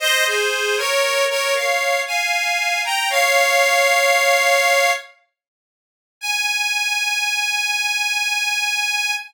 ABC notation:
X:1
M:3/4
L:1/16
Q:1/4=58
K:Ab
V:1 name="Harmonica"
[ce] [Ac]2 [Bd]2 [Bd] [df]2 [fa]3 [gb] | [df]8 z4 | a12 |]